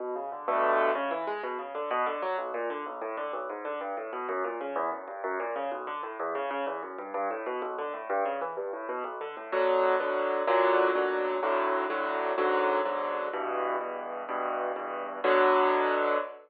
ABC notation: X:1
M:6/8
L:1/8
Q:3/8=126
K:Bm
V:1 name="Acoustic Grand Piano"
B,, C, D, [G,,B,,D,A,]3 | C, E, ^G, B,, C, D, | B,, D, F, B,,, ^A,, D, | B,,, A,, D, B,,, ^G,, D, |
G,, A,, B,, F,, ^A,, C, | E,, F,, G,, F,, ^A,, C, | B,,, D, A,, E,, C, C, | E,, F,, G,, G,, A,, B,, |
B,,, D, A,, G,, C, E, | G,, A,, B,, B,,, D, A,, | [B,,D,F,]3 [B,,D,F,]3 | [B,,,^A,,D,F,]3 [B,,,A,,D,F,]3 |
[B,,,A,,D,F,]3 [B,,,A,,D,F,]3 | [B,,,^G,,D,F,]3 [B,,,G,,D,F,]3 | [E,,G,,B,,]3 [E,,G,,B,,]3 | [E,,G,,B,,]3 [E,,G,,B,,]3 |
[B,,D,F,]6 |]